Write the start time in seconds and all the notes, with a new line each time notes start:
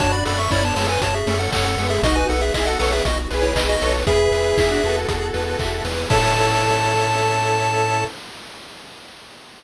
0.00 F#2 C#4 D4 F#4 A4 C#5 A5, kick, closed hi-hat
0.12 D5 B5
0.25 F#2 A4 D5 B5, open hi-hat
0.39 E5 C#6
0.50 F#2 C#4 E4 C#5 D5 B5, kick, clap
0.62 B3 D4 C#5 A5
0.75 F#2 G#3 B3 A4 C#5 A5, open hi-hat
0.89 B4 G#5
1.01 F#2 F#4 C#5 A5, kick, closed hi-hat
1.14 G#4 E5
1.26 F#2 A3 C#4 A4, open hi-hat
1.39 A4 F#5
1.53 F#2 A4 C#5 F#5, kick, clap
1.65 A4 F#5
1.77 F#2 G#3 B3 A4, open hi-hat
1.90 G#4 E5
2.03 B1 B3 D#4 F#4 D#5, kick, closed hi-hat
2.16 B4 G#5
2.29 B1 A4 B4 F#5, open hi-hat
2.41 G#4 E5
2.54 B1 E4 G#4 D#5 E5, kick, clap
2.67 F#4 A4 F#5
2.79 B1 A4 B4 C#5 F#5, open hi-hat
2.92 G#4 E5
3.05 B1 F#4 D#5, kick, closed hi-hat
3.31 B1 G#4 B4, open hi-hat
3.42 E4 C#5
3.55 B1 D#5, kick, clap
3.69 F#4 D#5
3.81 B1 A4 B4 C#5, open hi-hat
4.06 E2 B3 E4 G#4 B4 E5, kick, closed hi-hat
4.31 E2 B4, open hi-hat
4.56 E2 E4 G#4 E5, kick, clap
4.70 D4 F#4
4.83 E2 F#4 A4 B4, open hi-hat
5.08 E2 G#4, kick, closed hi-hat
5.34 E2 B4, open hi-hat
5.59 E2 E5, kick, clap
5.85 E2 B4, open hi-hat
6.09 A2 C#4 E4 A4 C#5 E5 A5, kick, crash